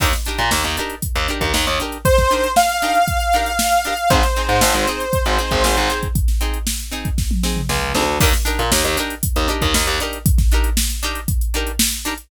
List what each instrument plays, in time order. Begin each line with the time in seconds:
0.00 electric bass (finger) D#2, acoustic guitar (steel) D4 D#4 G4 A#4, kick, crash
0.13 snare, closed hi-hat
0.25 acoustic guitar (steel) D4 D#4 G4 A#4, closed hi-hat
0.38 electric bass (finger) A#2, snare, closed hi-hat
0.51 electric bass (finger) D#2, snare
0.64 electric bass (finger) D#2, closed hi-hat
0.77 acoustic guitar (steel) D4 D#4 G4 A#4, closed hi-hat
0.90 closed hi-hat
1.02 kick, closed hi-hat
1.15 electric bass (finger) D#2, closed hi-hat
1.28 acoustic guitar (steel) D4 D#4 G4 A#4, closed hi-hat
1.41 electric bass (finger) D#2, kick, snare, closed hi-hat
1.54 electric bass (finger) D#2, snare
1.67 electric bass (finger) D#2, closed hi-hat
1.80 acoustic guitar (steel) D4 D#4 G4 A#4, closed hi-hat
1.92 closed hi-hat
2.05 lead 2 (sawtooth) C5, kick, closed hi-hat
2.18 kick, snare, closed hi-hat
2.31 acoustic guitar (steel) D4 D#4 G4 A#4, closed hi-hat
2.44 closed hi-hat
2.56 lead 2 (sawtooth) F5, snare
2.69 snare, closed hi-hat
2.82 acoustic guitar (steel) D4 D#4 G4 A#4, closed hi-hat
2.95 closed hi-hat
3.08 kick, closed hi-hat
3.20 closed hi-hat
3.33 acoustic guitar (steel) D4 D#4 G4 A#4, closed hi-hat
3.46 closed hi-hat
3.59 snare
3.72 closed hi-hat
3.85 acoustic guitar (steel) D4 D#4 G4 A#4, closed hi-hat
3.97 closed hi-hat
4.10 electric bass (finger) G#1, acoustic guitar (steel) C4 D#4 G#4, lead 2 (sawtooth) C5, kick, closed hi-hat
4.23 snare, closed hi-hat
4.36 acoustic guitar (steel) C4 D#4 G#4, closed hi-hat
4.49 electric bass (finger) G#2, snare, closed hi-hat
4.61 electric bass (finger) G#1, snare
4.74 electric bass (finger) G#1, closed hi-hat
4.87 acoustic guitar (steel) C4 D#4 G#4, closed hi-hat
5.00 closed hi-hat
5.13 kick, closed hi-hat
5.26 electric bass (finger) G#1, closed hi-hat
5.38 acoustic guitar (steel) C4 D#4 G#4, closed hi-hat
5.51 electric bass (finger) G#1, kick, closed hi-hat
5.64 electric bass (finger) G#1, snare
5.77 electric bass (finger) G#1, closed hi-hat
5.90 acoustic guitar (steel) C4 D#4 G#4, closed hi-hat
6.03 kick, closed hi-hat
6.15 kick, closed hi-hat
6.28 snare, closed hi-hat
6.41 acoustic guitar (steel) C4 D#4 G#4, closed hi-hat
6.54 closed hi-hat
6.67 snare
6.79 closed hi-hat
6.91 acoustic guitar (steel) C4 D#4 G#4, closed hi-hat
7.05 kick, closed hi-hat
7.18 kick, snare
7.31 high tom
7.43 acoustic guitar (steel) C4 D#4 G#4, snare
7.56 mid tom
7.69 electric bass (finger) C#2, snare
7.95 electric bass (finger) D2, acoustic guitar (steel) C4 D#4 G#4, snare
8.20 electric bass (finger) D#2, acoustic guitar (steel) D4 D#4 G4 A#4, kick, crash
8.33 snare, closed hi-hat
8.45 acoustic guitar (steel) D4 D#4 G4 A#4, closed hi-hat
8.59 electric bass (finger) A#2, snare, closed hi-hat
8.72 electric bass (finger) D#2, snare
8.84 electric bass (finger) D#2, closed hi-hat
8.97 acoustic guitar (steel) D4 D#4 G4 A#4, closed hi-hat
9.10 closed hi-hat
9.23 kick, closed hi-hat
9.36 electric bass (finger) D#2, closed hi-hat
9.48 acoustic guitar (steel) D4 D#4 G4 A#4, closed hi-hat
9.62 electric bass (finger) D#2, kick, snare, closed hi-hat
9.74 electric bass (finger) D#2, snare
9.87 electric bass (finger) D#2, closed hi-hat
10.00 acoustic guitar (steel) D4 D#4 G4 A#4, closed hi-hat
10.13 closed hi-hat
10.26 kick, closed hi-hat
10.38 kick, snare, closed hi-hat
10.51 acoustic guitar (steel) D4 D#4 G4 A#4, closed hi-hat
10.64 closed hi-hat
10.77 snare
10.90 snare, closed hi-hat
11.03 acoustic guitar (steel) D4 D#4 G4 A#4, closed hi-hat
11.15 closed hi-hat
11.28 kick, closed hi-hat
11.41 closed hi-hat
11.54 acoustic guitar (steel) D4 D#4 G4 A#4, closed hi-hat
11.67 closed hi-hat
11.79 snare
11.92 closed hi-hat
12.05 acoustic guitar (steel) D4 D#4 G4 A#4, closed hi-hat
12.18 closed hi-hat